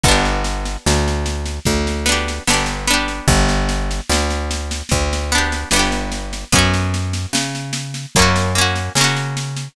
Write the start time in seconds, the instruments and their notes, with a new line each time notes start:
0.03 electric bass (finger) G1, pizzicato strings B3, kick, snare
0.08 pizzicato strings D4 G4
0.25 snare
0.44 snare
0.65 snare
0.86 electric bass (finger) D2, snare
1.08 snare
1.26 snare
1.45 snare
1.65 electric bass (finger) D2, kick, snare
1.87 snare
2.06 pizzicato strings B3 D4, snare
2.12 pizzicato strings G4
2.28 snare
2.47 electric bass (finger) G1, pizzicato strings B3 D4, snare
2.53 pizzicato strings G4
2.66 snare
2.87 pizzicato strings B3 D4, snare
2.93 pizzicato strings G4
3.08 snare
3.28 electric bass (finger) G1, kick, snare
3.48 snare
3.69 snare
3.91 snare
4.09 electric bass (finger) D2, snare
4.30 snare
4.51 snare
4.71 snare
4.89 electric bass (finger) D2, kick, snare
5.13 snare
5.32 pizzicato strings B3 D4, snare
5.38 pizzicato strings G4
5.52 snare
5.71 electric bass (finger) G1, pizzicato strings B3, snare
5.76 pizzicato strings D4 G4
5.92 snare
6.12 snare
6.33 snare
6.52 electric bass (finger) F#2, pizzicato strings B3 C#4, kick, snare
6.58 pizzicato strings F#4
6.73 snare
6.94 snare
7.13 snare
7.33 electric bass (finger) C#3, snare
7.55 snare
7.73 snare
7.94 snare
8.15 electric bass (finger) F#2, pizzicato strings A#3 C#4, kick, snare
8.22 pizzicato strings F#4
8.36 snare
8.55 pizzicato strings A#3 C#4, snare
8.61 pizzicato strings F#4
8.76 snare
8.95 electric bass (finger) C#3, pizzicato strings A#3, snare
9.01 pizzicato strings C#4 F#4
9.16 snare
9.37 snare
9.56 snare